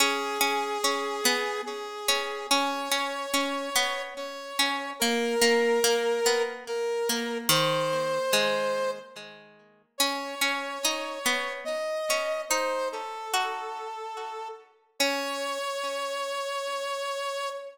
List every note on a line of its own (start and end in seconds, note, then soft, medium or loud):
0.00 0.38 C#4 loud
0.00 1.61 G#4 medium
0.41 0.78 C#4 loud
0.84 1.21 C#4 loud
1.25 1.62 B3 loud
1.66 2.47 G#4 medium
2.08 2.47 C#4 loud
2.50 2.89 C#4 loud
2.50 4.02 C#5 medium
2.91 3.26 C#4 medium
3.34 3.70 C#4 loud
3.76 4.14 B3 loud
4.17 4.91 C#5 medium
4.59 4.93 C#4 loud
4.99 5.35 A#3 loud
4.99 6.42 A#4 medium
5.41 5.80 A#3 loud
5.84 6.20 A#3 loud
6.26 6.64 B3 loud
6.68 7.38 A#4 medium
7.09 7.50 A#3 loud
7.49 8.19 D#3 loud
7.49 8.91 C5 medium
8.33 9.09 G#3 loud
9.98 10.35 C#4 loud
9.98 11.53 C#5 medium
10.41 10.78 C#4 loud
10.85 11.19 D#4 loud
11.26 11.64 B3 loud
11.65 12.42 D#5 medium
12.10 12.45 C#4 medium
12.49 13.23 D#4 loud
12.49 12.89 C5 medium
12.92 14.48 A4 medium
13.34 14.94 F#4 loud
14.99 17.50 C#4 loud
14.99 17.49 C#5 loud